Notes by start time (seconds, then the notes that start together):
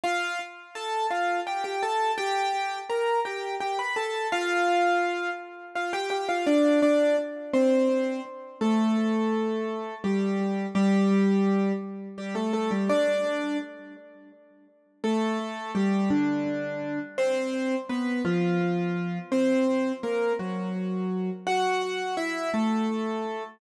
0.04 F4 F5
0.75 A4 A5
1.11 F4 F5
1.47 G4 G5
1.64 G4 G5
1.83 A4 A5
2.18 G4 G5
2.90 A#4 A#5
3.25 G4 G5
3.61 G4 G5
3.79 B4 B5
3.96 A4 A5
4.32 F4 F5
5.75 F4 F5
5.93 G4 G5
6.10 G4 G5
6.29 F4 F5
6.47 D4 D5
6.82 D4 D5
7.54 C4 C5
8.61 A3 A4
10.04 G3 G4
10.75 G3 G4
12.18 G3 G4
12.35 A3 A4
12.53 A3 A4
12.71 G3 G4
12.89 D4 D5
15.04 A3 A4
15.75 G3 G4
16.10 D3 D4
17.18 C4 C5
17.89 B3 B4
18.25 F3 F4
19.32 C4 C5
20.03 A#3 A#4
20.39 F#3 F#4
21.47 F#4 F#5
22.17 E4 E5
22.54 A3 A4